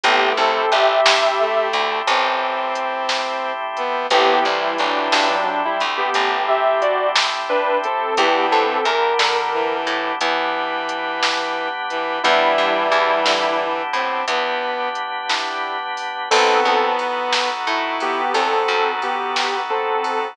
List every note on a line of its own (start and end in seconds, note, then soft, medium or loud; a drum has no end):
0.04 0.33 A1 medium
0.04 0.60 A3 loud
0.04 0.51 A3 medium
0.04 4.07 A3 medium
0.04 0.35 B3 medium
0.04 0.51 C4 medium
0.04 4.07 C4 medium
0.04 0.51 E4 medium
0.04 4.07 E4 medium
0.04 0.35 G4 medium
0.04 0.51 G4 medium
0.04 4.07 G4 medium
0.04 kick loud
0.04 closed hi-hat medium
0.37 0.66 C2 medium
0.37 0.70 C4 medium
0.37 0.70 A4 medium
0.72 1.01 A1 medium
0.72 1.67 G4 medium
0.72 1.67 E5 medium
0.72 closed hi-hat medium
1.06 1.64 G2 medium
1.06 snare loud
1.39 2.01 A3 loud
1.73 2.02 D2 medium
1.73 closed hi-hat medium
2.07 3.80 A1 medium
2.07 3.52 C4 medium
2.07 kick medium
2.07 closed hi-hat medium
2.75 closed hi-hat medium
3.09 snare medium
3.77 4.07 B3 loud
3.77 closed hi-hat medium
4.10 4.40 A1 medium
4.10 5.35 E3 loud
4.10 4.58 A3 medium
4.10 8.13 A3 medium
4.10 4.44 B3 medium
4.10 4.58 C4 medium
4.10 8.13 C4 medium
4.10 4.58 E4 medium
4.10 8.13 E4 medium
4.10 4.44 G4 medium
4.10 4.58 G4 medium
4.10 8.13 G4 medium
4.10 kick medium
4.10 closed hi-hat medium
4.45 4.74 C2 medium
4.45 4.76 G3 medium
4.45 4.76 E4 medium
4.78 5.08 A1 medium
4.78 5.09 F#3 medium
4.78 5.09 D4 medium
4.78 closed hi-hat medium
5.12 5.70 G2 medium
5.12 5.29 F#3 medium
5.12 5.29 D4 medium
5.12 snare loud
5.30 5.45 F#3 medium
5.30 5.45 D4 medium
5.45 5.61 F#3 medium
5.45 5.61 D4 medium
5.65 5.81 G3 medium
5.65 5.81 E4 medium
5.80 6.10 D2 medium
5.80 closed hi-hat medium
5.97 6.42 B3 medium
5.97 6.42 G4 medium
6.14 7.88 A1 medium
6.14 kick medium
6.14 closed hi-hat medium
6.48 6.81 G4 medium
6.48 6.81 E5 medium
6.82 7.09 F#4 medium
6.82 7.09 D5 medium
6.82 closed hi-hat medium
7.16 snare loud
7.49 7.77 D4 medium
7.49 7.77 B4 medium
7.84 8.17 C4 medium
7.84 8.17 A4 medium
7.84 closed hi-hat medium
8.17 8.46 E2 medium
8.17 8.78 E3 loud
8.17 8.65 B3 medium
8.17 10.19 B3 medium
8.17 8.45 B3 medium
8.17 8.65 D4 medium
8.17 10.19 D4 medium
8.17 8.65 E4 medium
8.17 10.19 E4 medium
8.17 8.65 G4 medium
8.17 10.19 G4 medium
8.17 8.45 G4 medium
8.17 kick medium
8.17 closed hi-hat medium
8.52 8.81 G2 medium
8.52 8.85 C4 medium
8.52 8.85 A4 medium
8.85 9.14 E2 medium
8.85 9.76 A#4 medium
8.85 closed hi-hat medium
9.19 9.77 D3 medium
9.19 snare loud
9.53 10.12 E3 loud
9.87 10.16 A2 medium
9.87 closed hi-hat medium
10.21 11.94 E2 medium
10.21 11.69 E3 medium
10.21 12.22 B3 medium
10.21 12.22 D4 medium
10.21 12.22 G4 medium
10.21 12.22 B4 medium
10.21 kick medium
10.21 closed hi-hat medium
10.89 closed hi-hat medium
11.23 snare loud
11.90 12.19 E3 medium
11.90 closed hi-hat medium
12.23 12.53 E2 medium
12.23 13.82 E3 loud
12.23 13.64 G3 medium
12.23 14.26 B3 medium
12.23 12.72 B3 medium
12.23 14.26 D4 medium
12.23 12.72 D4 medium
12.23 13.64 E4 medium
12.23 14.26 E4 medium
12.23 12.72 E4 medium
12.23 14.26 G4 medium
12.23 12.72 G4 medium
12.23 kick medium
12.23 closed hi-hat medium
12.58 12.87 G2 medium
12.92 13.20 E2 medium
12.92 closed hi-hat medium
13.26 13.83 D3 medium
13.26 snare medium
13.93 14.22 A2 medium
13.93 14.24 C4 medium
13.93 closed hi-hat medium
14.28 16.01 E2 medium
14.28 16.29 B3 medium
14.28 14.89 B3 medium
14.28 16.29 D4 medium
14.28 16.29 G4 medium
14.28 16.29 B4 medium
14.28 kick medium
14.28 closed hi-hat medium
14.95 closed hi-hat medium
15.29 15.77 B3 medium
15.29 15.77 D4 medium
15.29 15.77 E4 medium
15.29 15.77 G4 medium
15.29 snare medium
15.97 open hi-hat medium
16.31 16.61 B1 medium
16.31 17.49 B3 loud
16.31 20.34 B3 medium
16.31 16.79 B3 medium
16.31 16.63 C4 medium
16.31 20.34 D#4 medium
16.31 16.79 D#4 medium
16.31 20.34 F#4 medium
16.31 16.79 F#4 medium
16.31 16.63 A4 medium
16.31 20.34 A4 medium
16.31 16.79 A4 medium
16.31 kick loud
16.31 crash loud
16.65 17.52 E2 medium
16.65 16.94 C4 medium
16.65 16.94 A4 medium
16.99 ride medium
17.32 snare loud
17.67 18.25 A2 medium
17.67 18.21 E4 loud
18.00 18.33 B3 medium
18.00 18.33 G4 medium
18.00 ride medium
18.34 18.63 E2 medium
18.34 18.91 C4 medium
18.34 18.91 A4 medium
18.34 kick medium
18.34 ride medium
18.68 20.12 F#2 medium
19.02 19.60 B3 medium
19.02 19.60 G4 medium
19.02 ride medium
19.36 snare medium
19.70 20.28 C4 medium
19.70 20.28 A4 medium
20.04 ride medium